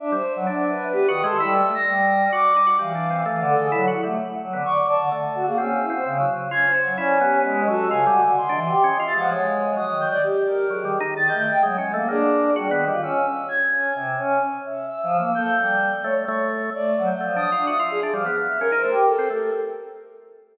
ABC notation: X:1
M:3/4
L:1/16
Q:1/4=129
K:none
V:1 name="Choir Aahs"
D c2 _G, D2 B2 (3B2 _E,2 A2 | G,2 A, z G,4 z4 | E,4 (3E,2 D,2 _A2 (3_G,2 E2 =A,2 | z2 _G, D, (3d2 d2 D,2 z2 _G _B, |
_D2 E c _D,2 z2 (3D2 c2 _G,2 | _D4 _A,2 =A2 (3_D,2 _G2 =D,2 | (3_e2 =E,2 G2 (3_e2 =e2 F,2 _A,4 | (3_e2 _E,2 e2 z2 _B2 z E, z2 |
(3_E,2 A,2 =e2 (3_G,2 _A,2 _B,2 D4 | G, _E,2 F _D2 z4 D2 | C,2 _D2 z2 e2 (3e2 F,2 _B,2 | A2 G,3 z _d z d2 z2 |
A,2 _G, z F,2 z D e2 z2 | F, z2 e (3_B2 c2 G2 z4 |]
V:2 name="Flute"
e8 (3G2 _e'2 c'2 | e'3 _b'3 z2 d'4 | f6 A2 z4 | z4 _d'2 a2 z3 _A |
e'6 z2 _a'4 | d2 G4 _G2 _a4 | c'6 a' _g _d4 | _e'2 g' d G4 _A4 |
a' g' _e g z4 _A4 | z4 e'4 _a'4 | z8 e'4 | g'4 z4 _d'4 |
(3d4 g'4 _e'4 e' z _A2 | f'4 _B4 A2 B2 |]
V:3 name="Drawbar Organ"
z G, z2 D4 (3B,2 _G2 _A,2 | (3E2 A,2 A,2 z4 _G2 _E G | (3G,2 D2 C2 A,4 (3E2 _G2 =G,2 | z3 B, z4 A,3 z |
(3C4 C4 _G,4 F2 _D2 | E2 B,4 _G,2 (3F2 =G,2 G,2 | z D z2 (3_D2 F2 _A,2 A,4 | _G,4 z4 (3G,2 =G,2 _E2 |
z4 (3_A,2 _D2 =A,2 _B,4 | (3_G2 B,2 =G,2 z8 | z12 | z6 A,2 A,4 |
z4 (3A,2 D2 F2 _G F2 D | G, B, B,2 _D _E A, z2 C A,2 |]